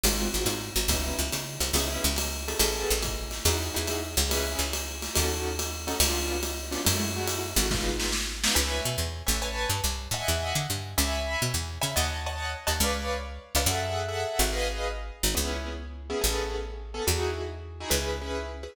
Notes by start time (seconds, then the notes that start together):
0.04 G#1 G#3 C4 F4 F#4, ride
0.34 G#1 G#3 C4 F4 F#4
0.46 G#2, hi-hat pedal, ride
0.76 G#1, ride
0.88 C#2 B3 C#4 D#4 E4, kick, ride
1.19 C#2
1.33 C#3, hi-hat pedal, ride
1.60 C2, ride
1.73 C#2 B3 C#4 E4 G#4, ride
2.04 C#2
2.16 hi-hat pedal, ride
2.48 B3 C#4 G#4 A4, ride
2.59 A1, ride
2.91 A1
3.03 kick, hi-hat pedal, ride
3.31 snare, ride
3.45 E2 D#4 E4 F#4 G#4, ride
3.74 E2 D#4 E4 F#4 G#4
3.87 hi-hat pedal, ride
4.17 C#2, ride
4.29 C#4 E4 G#4 B4, ride
4.59 C#2
4.73 hi-hat pedal, ride
5.02 snare, ride
5.14 D#2 C#4 D#4 F#4 A4, ride
5.59 hi-hat pedal, ride
5.87 C#4 D#4 F#4 A4, ride
6.00 C#2 B3 C#4 D4 F4, ride
6.43 hi-hat pedal, ride
6.71 B3 C#4 D4 F4, snare, ride
6.85 F#2 G#3 A3 E4 F#4, ride
7.16 G#3 A3 E4 F#4
7.28 hi-hat pedal, ride
7.56 G#1 G#3 A3 E4 F#4, ride
7.71 G#3 B3 D#4 F4, kick, snare
8.00 snare
8.12 snare
8.44 G#3 B3 D#4 F4, snare
8.55 C#2 B4 C#5 E5 G#5
8.85 B2
8.98 E2
9.27 A1 B4 C#5 E5 G#5
9.42 B4 C#5 G#5 A5
9.70 G2
9.84 C2
10.11 A2 D#5 E5 F#5 G#5
10.28 E2
10.55 D3
10.70 G2
10.98 C#2 C#5 E5 G#5 B5
11.42 B2
11.54 E2
11.81 C#3 C#5 E5 G#5 B5
11.96 D#2 C#5 D#5 F#5 A5
12.26 C#5 D#5 F#5 A5
12.67 D#2 C#5 D#5 F#5 A5
12.80 C#2 B4 C#5 D5 F5
13.55 C#2 B4 C#5 D5 F5
13.66 F#2 G#4 A4 E5 F#5
14.08 G#4 A4 E5 F#5
14.39 G#1
14.53 G#4 B4 D#5 F5
15.23 G#1
15.35 C#2 B3 C#4 E4 G#4
16.10 B3 C#4 E4 G#4
16.21 A1 B3 C#4 G#4 A4
16.94 B3 C#4 G#4 A4
17.07 E2 D#4 E4 F#4 G#4
17.80 D#4 E4 F#4 G#4
17.90 C#2 C#4 E4 G#4 B4
18.21 C#4 E4 G#4 B4
18.63 C#4 E4 G#4 B4